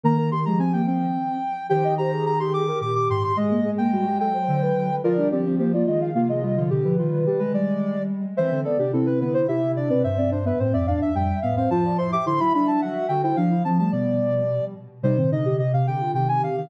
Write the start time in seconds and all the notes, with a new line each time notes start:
0.03 D#3 A#3 A#4 A#5
0.18 A#4
0.31 D#3 G4 C6
0.45 F3 G#3 A#5
0.58 C4 G#5
0.73 A#3 G5
0.86 C4 G5
1.69 D#3 G4 C5 G5
1.84 D#5
1.98 G4 C5 A#5
2.12 G#4
2.26 G#4 A#5
2.40 G4 G#4 C6
2.53 G#4 D6
2.68 G4 A#4
2.81 A#2 G4 D6
2.95 D6
3.09 G#2 G4 C6
3.23 C6
3.36 G#3 G#4 D#5
3.51 A#3
3.65 G#3 G#4
3.78 A#3 G5
3.92 G3 F#4
4.06 F#3 G4
4.20 A4 G5
4.34 C5
4.48 D3 C5
4.62 B4
4.76 D3
5.04 F3 F4 A#4 D5
5.17 G3 D4
5.31 F3 C4 G4 D5
5.45 F3 C4
5.59 F3 A#3 G4 C5
5.73 A#3 F4 D5
5.86 D#3 G#3 F4 D#5
6.01 F5
6.15 C3 A#3 F4 F5
6.28 G#3 F4 D#5
6.42 G3 F4
6.56 D3 F3 F4
6.70 B2 D3 G4
6.84 D3 F3 B4
6.98 D#3 G3 F4
7.12 D#3
7.26 G3 G4
7.39 G3 G#3 B4
7.54 G3 D5
8.36 E3 C4 C5 E5
8.51 D3 C4
8.64 B3 A4 D5
8.78 C3 D4 G4
8.93 C3 C4 E4 A4
9.06 C4 B4
9.20 D3 B3 B4
9.34 C5
9.48 C3 E4 G4 E5
9.76 D4 D5
9.89 B2 C4 B4 D5
10.03 G2 C4 C5 E5
10.18 C4 D5
10.31 D4 C5
10.45 B3 B4 E5
10.59 A2 C4 C5
10.73 F2 C4 D5 E5
10.87 E2 D4 D5 F5
11.01 E5
11.15 F2 G3 G5
11.42 A2 B3 F5
11.56 C4 C5 F5
11.70 F3 F4 C5 A5
11.84 F4 D5
11.98 E4 C5 C6
12.12 G4 E5 D6
12.26 D3 E4 C5 C6
12.40 F#3 E4 E5 B5
12.54 G3 D4 E5 B5
12.67 E5 A5
12.81 F#3 F#4 F#5
13.08 D3 F#4 G5
13.23 E4 C5 G5
13.36 F3 D4 F5
13.51 E4
13.64 F3 C4 A5
13.78 G3 A3 A5
13.92 B2 B3 D5
15.03 C3 G3 D#4 C5
15.17 A#2 D#3 C4
15.31 C3 D3 D#4 D#5
15.45 C3 D3 G4
15.59 C3 G4 D#5
15.73 C3 G4 F5
15.87 C3 D3 G4 G5
16.01 F4
16.14 C3 D#3 G4 G5
16.28 C3 G#5
16.42 C3 F5
16.56 C3 D#3 F5